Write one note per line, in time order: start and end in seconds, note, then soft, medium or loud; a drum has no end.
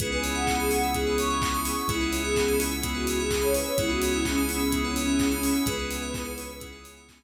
0.00 1.74 C#2 loud
0.00 1.87 B3 medium
0.00 0.86 B3 medium
0.00 1.87 C#4 medium
0.00 0.86 C#4 loud
0.00 1.87 E4 loud
0.00 0.86 E4 medium
0.00 0.11 G#4 loud
0.00 1.87 G#4 loud
0.00 0.86 G#4 loud
0.00 0.11 B4 loud
0.00 kick loud
0.00 closed hi-hat loud
0.12 0.23 B4 medium
0.12 0.33 G#5 medium
0.23 0.34 C#5 medium
0.23 open hi-hat medium
0.35 0.45 E5 medium
0.35 0.56 F#5 medium
0.47 0.58 G#5 medium
0.47 kick medium
0.47 clap loud
0.60 0.71 G#4 loud
0.60 0.70 B5 medium
0.70 0.93 F#5 loud
0.70 0.81 C#6 medium
0.70 open hi-hat medium
0.83 0.94 E6 medium
0.94 1.80 B3 medium
0.94 1.80 C#4 medium
0.94 1.80 E4 medium
0.94 1.80 G#4 medium
0.94 1.14 G#4 loud
0.94 1.06 G#4 medium
0.94 kick medium
0.94 closed hi-hat medium
1.07 1.18 B4 medium
1.18 1.29 C#5 medium
1.18 1.59 C#6 loud
1.18 open hi-hat medium
1.30 1.41 E5 medium
1.42 1.53 G#5 medium
1.42 kick loud
1.42 clap loud
1.54 1.65 B5 medium
1.65 1.75 C#6 medium
1.65 1.76 C#6 loud
1.65 open hi-hat medium
1.77 1.88 C#6 loud
1.77 1.89 E6 medium
1.88 3.62 C#2 loud
1.88 2.73 B3 medium
1.88 3.76 B3 medium
1.88 2.73 C#4 medium
1.88 3.76 C#4 medium
1.88 2.73 E4 loud
1.88 3.76 E4 loud
1.88 2.21 E4 loud
1.88 2.73 G#4 medium
1.88 3.76 G#4 medium
1.88 2.00 G#4 medium
1.88 kick loud
1.88 closed hi-hat loud
2.01 2.11 B4 medium
2.12 2.23 C#5 medium
2.12 open hi-hat medium
2.24 2.53 G#4 loud
2.24 2.35 E5 medium
2.36 2.47 G#5 medium
2.36 kick medium
2.36 clap loud
2.48 2.59 B5 medium
2.60 2.71 C#6 medium
2.60 open hi-hat medium
2.71 2.82 E6 medium
2.83 3.68 B3 medium
2.83 3.68 C#4 medium
2.83 3.68 E4 medium
2.83 2.94 G#4 medium
2.83 3.68 G#4 medium
2.83 kick medium
2.83 closed hi-hat loud
2.94 3.06 F#4 medium
2.94 3.05 B4 medium
3.07 3.18 F#4 loud
3.07 3.18 C#5 medium
3.07 open hi-hat medium
3.19 3.30 G#4 loud
3.19 3.30 E5 medium
3.31 3.42 G#4 loud
3.31 3.41 G#5 medium
3.31 kick medium
3.31 clap loud
3.42 3.54 C#5 loud
3.42 3.52 B5 medium
3.54 3.66 B4 loud
3.54 3.66 C#6 medium
3.54 open hi-hat medium
3.66 3.78 C#5 loud
3.66 3.76 E6 medium
3.78 5.52 C#2 loud
3.78 4.63 B3 loud
3.78 5.65 B3 medium
3.78 4.63 C#4 medium
3.78 5.65 C#4 medium
3.78 4.63 E4 medium
3.78 5.65 E4 loud
3.78 3.90 E4 loud
3.78 4.63 G#4 medium
3.78 5.65 G#4 loud
3.78 3.89 G#4 loud
3.78 kick loud
3.78 closed hi-hat loud
3.89 4.13 F#4 loud
3.89 4.00 B4 medium
4.02 4.13 C#5 medium
4.02 open hi-hat medium
4.13 4.24 E4 loud
4.13 4.23 E5 medium
4.25 4.37 C#4 loud
4.25 4.36 G#5 medium
4.25 kick medium
4.25 clap loud
4.38 4.48 B5 medium
4.48 4.78 C#4 loud
4.48 4.61 C#6 medium
4.48 open hi-hat medium
4.59 4.70 E6 medium
4.72 5.58 B3 medium
4.72 5.58 C#4 medium
4.72 5.58 E4 medium
4.72 4.82 G#4 medium
4.72 5.58 G#4 medium
4.72 kick medium
4.72 closed hi-hat loud
4.84 4.95 C#4 medium
4.84 4.95 B4 medium
4.96 5.28 C#4 loud
4.96 5.07 C#5 medium
4.96 open hi-hat medium
5.07 5.18 E5 medium
5.19 5.30 G#5 medium
5.19 kick medium
5.19 clap loud
5.31 5.61 C#4 loud
5.31 5.42 B5 medium
5.43 5.54 C#6 medium
5.43 open hi-hat medium
5.55 5.65 E6 medium
5.66 7.23 C#2 loud
5.66 6.52 B3 medium
5.66 7.23 B3 medium
5.66 6.52 C#4 medium
5.66 7.23 C#4 medium
5.66 6.52 E4 medium
5.66 7.23 E4 medium
5.66 5.77 G#4 loud
5.66 6.52 G#4 medium
5.66 7.23 G#4 medium
5.66 6.55 B4 loud
5.66 kick loud
5.66 closed hi-hat loud
5.79 5.90 B4 medium
5.91 6.02 C#5 medium
5.91 open hi-hat medium
6.02 6.13 E5 medium
6.14 6.25 G#5 medium
6.14 kick loud
6.14 clap loud
6.25 6.35 B5 medium
6.38 6.48 C#6 medium
6.38 open hi-hat medium
6.50 6.61 E6 medium
6.60 7.23 B3 medium
6.60 7.23 C#4 medium
6.60 7.23 E4 medium
6.60 6.71 G#4 medium
6.60 7.23 G#4 medium
6.60 kick medium
6.60 closed hi-hat loud
6.72 6.83 B4 medium
6.84 6.94 C#5 medium
6.84 open hi-hat medium
6.97 7.07 E5 medium
7.09 7.20 G#5 medium
7.09 kick medium
7.09 clap loud
7.21 7.23 B5 medium